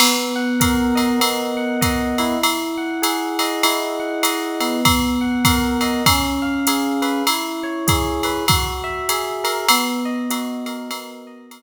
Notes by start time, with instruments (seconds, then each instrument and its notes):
0.00 electric piano 1 B3, crash, ride
0.36 electric piano 1 F#5
0.60 electric piano 1 A#4, kick, hi-hat pedal, ride
0.95 electric piano 1 D#5, ride
1.20 electric piano 1 B3, ride
1.57 electric piano 1 F#5
1.81 electric piano 1 D#5, kick, hi-hat pedal, ride
2.18 electric piano 1 E4, ride
2.43 ride
2.78 electric piano 1 F#5
3.02 electric piano 1 G#4, hi-hat pedal, ride
3.39 electric piano 1 D#5, ride
3.63 electric piano 1 E4, ride
4.00 electric piano 1 F#5
4.23 electric piano 1 D#5, hi-hat pedal, ride
4.60 electric piano 1 B3, ride
4.85 kick, ride
5.21 electric piano 1 F#5
5.45 electric piano 1 A#4, kick, hi-hat pedal, ride
5.81 electric piano 1 D#5, ride
6.06 electric piano 1 C#4, kick, ride
6.42 electric piano 1 F5
6.67 electric piano 1 G#4, hi-hat pedal, ride
7.02 electric piano 1 B4, ride
7.27 electric piano 1 E4, ride
7.63 electric piano 1 C#5
7.87 electric piano 1 G#4, kick, hi-hat pedal, ride
8.23 electric piano 1 B4, ride
8.48 electric piano 1 F#4, kick, ride
8.84 electric piano 1 E5
9.09 electric piano 1 G#4, hi-hat pedal, ride
9.44 electric piano 1 A#4, ride
9.69 electric piano 1 B3, ride
10.05 electric piano 1 D#5
10.30 electric piano 1 F#4, hi-hat pedal, ride
10.66 electric piano 1 A#4, ride
10.91 electric piano 1 B3, ride
11.27 electric piano 1 D#5
11.51 electric piano 1 A#4, hi-hat pedal, ride